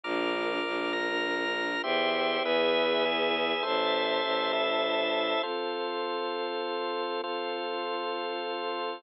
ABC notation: X:1
M:3/4
L:1/8
Q:1/4=100
K:Dm
V:1 name="Choir Aahs"
[DFB]6 | [ceg]2 [=Be^g]4 | [cea]6 | [K:F] [F,CA]6 |
[F,CA]6 |]
V:2 name="Drawbar Organ"
[bd'f']3 [bf'b']3 | [Gce]2 [^G=Be]2 [EGe]2 | [Ace]3 [EAe]3 | [K:F] [FAc]6 |
[FAc]6 |]
V:3 name="Violin" clef=bass
B,,,2 B,,,4 | E,,2 E,,4 | A,,,2 A,,,4 | [K:F] z6 |
z6 |]